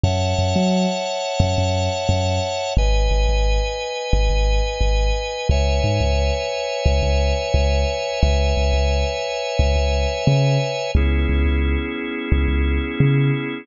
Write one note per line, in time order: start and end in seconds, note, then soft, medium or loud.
0.04 0.34 F#2 medium
0.04 2.74 C#5 loud
0.04 2.74 E5 medium
0.04 2.74 F#5 medium
0.04 2.74 A5 medium
0.38 0.54 F#2 medium
0.56 0.86 F#3 medium
1.40 1.55 F#2 medium
1.58 1.89 F#2 medium
2.09 2.40 F#2 medium
2.77 3.08 G#1 medium
2.77 5.48 B4 loud
2.77 5.48 D#5 medium
2.77 5.48 G#5 medium
3.11 3.26 G#1 medium
3.29 3.60 G#1 medium
4.13 4.28 G#1 medium
4.30 4.61 G#1 medium
4.81 5.12 G#1 medium
5.49 5.80 C#2 medium
5.49 8.21 B4 medium
5.49 8.21 C#5 loud
5.49 8.21 E5 medium
5.49 8.21 G#5 medium
5.84 5.99 G#2 medium
6.00 6.31 C#2 medium
6.86 7.01 C#2 medium
7.03 7.33 C#2 medium
7.54 7.85 C#2 medium
8.21 8.53 C#2 medium
8.21 10.91 B4 medium
8.21 10.91 C#5 medium
8.21 10.91 E5 medium
8.21 10.91 G#5 medium
8.57 8.72 C#2 medium
8.73 9.04 C#2 medium
9.59 9.75 C#2 medium
9.76 10.06 C#2 medium
10.27 10.58 C#3 medium
10.95 11.26 C#2 loud
10.95 13.66 B3 medium
10.95 13.66 C#4 loud
10.95 13.66 E4 medium
10.95 13.66 G#4 medium
11.29 11.44 C#2 medium
11.46 11.76 C#2 medium
12.32 12.47 C#2 medium
12.48 12.79 C#2 medium
13.00 13.31 C#3 medium